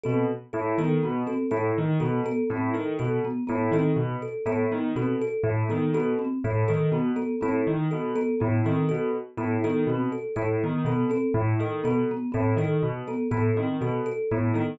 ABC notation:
X:1
M:3/4
L:1/8
Q:1/4=122
K:none
V:1 name="Acoustic Grand Piano" clef=bass
B,, z A,, _E, B,, z | A,, _E, B,, z A,, E, | B,, z A,, _E, B,, z | A,, _E, B,, z A,, E, |
B,, z A,, _E, B,, z | A,, _E, B,, z A,, E, | B,, z A,, _E, B,, z | A,, _E, B,, z A,, E, |
B,, z A,, _E, B,, z | A,, _E, B,, z A,, E, |]
V:2 name="Marimba"
C z2 B, B, C | z2 B, B, C z | z B, B, C z2 | B, B, C z2 B, |
B, C z2 B, B, | C z2 B, B, C | z2 B, B, C z | z B, B, C z2 |
B, B, C z2 B, | B, C z2 B, B, |]
V:3 name="Kalimba"
A z A A z A | A z A A z A | A z A A z A | A z A A z A |
A z A A z A | A z A A z A | A z A A z A | A z A A z A |
A z A A z A | A z A A z A |]